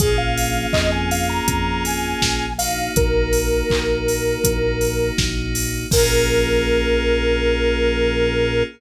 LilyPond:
<<
  \new Staff \with { instrumentName = "Lead 1 (square)" } { \time 4/4 \key bes \minor \tempo 4 = 81 aes'16 f''8. ees''16 aes''16 f''16 bes''8. aes''4 f''8 | bes'2. r4 | bes'1 | }
  \new Staff \with { instrumentName = "Electric Piano 2" } { \time 4/4 \key bes \minor <bes des' f' aes'>2.~ <bes des' f' aes'>8 <bes ees' ges'>8~ | <bes ees' ges'>1 | <bes des' f' aes'>1 | }
  \new Staff \with { instrumentName = "Synth Bass 1" } { \clef bass \time 4/4 \key bes \minor bes,,4 f,4 f,4 bes,,4 | bes,,4 bes,,4 bes,,4 bes,,4 | bes,,1 | }
  \new DrumStaff \with { instrumentName = "Drums" } \drummode { \time 4/4 <hh bd>8 hho8 <hc bd>8 hho8 <hh bd>8 hho8 <bd sn>8 hho8 | <hh bd>8 hho8 <hc bd>8 hho8 <hh bd>8 hho8 <bd sn>8 hho8 | <cymc bd>4 r4 r4 r4 | }
>>